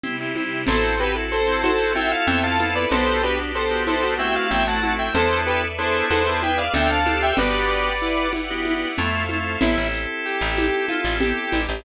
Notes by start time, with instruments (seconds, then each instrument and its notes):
0.04 string ensemble 1 C3 G3 E4, drawbar organ C4 E4 G4, low conga, shaker
0.20 drawbar organ C4 E4 G4
0.36 drawbar organ C4 E4 G4, high conga, shaker
0.67 electric bass (finger) A1, drawbar organ C4 E4 F#4 A4, string ensemble 1 C4 E4 F#4 A4, lead 1 (square) A4 C5, low conga, shaker
1.00 drawbar organ C4 E4 F#4 A4, lead 1 (square) G4 B4, shaker
1.15 drawbar organ C4 E4 F#4 A4
1.31 lead 1 (square) A4 C5, shaker
1.48 drawbar organ C4 E4 F#4 A4
1.63 lead 1 (square) F#4 A4 C5, tambourine, high conga, shaker
1.95 drawbar organ C4 E4 F4 A4, lead 1 (square) E5 G5, high conga, shaker
2.11 lead 1 (square) F5
2.27 electric bass (finger) F2, lead 1 (square) C4 E5 G5, string ensemble 1 C4 E4 F4 A4, low conga, shaker
2.43 drawbar organ C4 E4 F4 A4, lead 1 (square) F5 A5
2.59 lead 1 (square) B3, drawbar organ C4 E4 F4 A4, high conga, shaker
2.75 lead 1 (square) B4 D5
2.91 electric bass (finger) B1, string ensemble 1 B3 D4 F#4 G4, drawbar organ B3 D4 F#4 G4, lead 1 (square) B3 A4 C5, low conga, shaker
3.23 drawbar organ B3 D4 F#4 G4, lead 1 (square) D4 G4 B4, shaker
3.39 drawbar organ B3 D4 F#4 G4
3.55 lead 1 (square) A4 C5, shaker
3.71 drawbar organ B3 D4 F#4 G4
3.87 lead 1 (square) E4 A4 C5, tambourine, high conga, shaker
4.03 lead 1 (square) F#4
4.18 drawbar organ A3 C4 E4 F#4, lead 1 (square) E5 G5, shaker
4.35 lead 1 (square) F5
4.51 electric bass (finger) A1, string ensemble 1 A3 C4 E4 F#4, lead 1 (square) E5 G5, low conga, shaker
4.67 drawbar organ A3 C4 E4 F#4, lead 1 (square) F#5 A5
4.83 drawbar organ A3 C4 E4 F#4, high conga, shaker
4.99 lead 1 (square) E5 G5
5.14 electric bass (finger) E2, drawbar organ B3 D4 E4 A4, string ensemble 1 A4 B4 D5 E5, lead 1 (square) A4 C5, low conga, shaker
5.46 lead 1 (square) G4 B4, shaker
5.78 drawbar organ B3 D4 E4 G#4, lead 1 (square) A4 C5, shaker
6.10 electric bass (finger) E2, string ensemble 1 G#4 B4 D5 E5, lead 1 (square) A4 B4 C5, tambourine, high conga, shaker
6.27 drawbar organ B3 D4 E4 G#4
6.42 lead 1 (square) G5, high conga, shaker
6.58 lead 1 (square) D5 F5
6.74 electric bass (finger) D2, drawbar organ C4 D4 F4 A4, lead 1 (square) D4 E5 G5, string ensemble 1 A4 C5 D5 F5, low conga, shaker
6.90 lead 1 (square) F5 A5
7.05 drawbar organ C4 D4 F4 A4, lead 1 (square) G4, high conga, shaker
7.22 lead 1 (square) E5 G5
7.37 electric bass (finger) G1, drawbar organ B3 D4 F#4 G4, lead 1 (square) G4 B4 D5, string ensemble 1 G4 B4 D5 F#5, low conga, shaker
7.70 shaker
8.01 lead 1 (square) E4, shaker
8.33 lead 1 (square) E4, tambourine, high conga, shaker
8.50 drawbar organ B3 D4 F#4 G4
8.65 high conga, shaker
8.98 electric bass (finger) F2, drawbar organ A3 C4 E4 F4, string ensemble 1 A4 C5 E5 F5, low conga, shaker
9.29 drawbar organ A3 C4 E4 F4, high conga, shaker
9.61 electric bass (finger) A1, drawbar organ C4 E4 G4 A4, lead 1 (square) E4, low conga, shaker
9.78 electric bass (finger) A1
9.93 shaker
10.25 lead 1 (square) G4, shaker
10.41 electric bass (finger) A1
10.57 tambourine, high conga, shaker
10.89 lead 1 (square) F4, high conga, shaker
11.05 electric bass (finger) A1
11.20 lead 1 (square) G4, low conga, shaker
11.52 electric bass (finger) A1, high conga, shaker
11.69 electric bass (finger) A1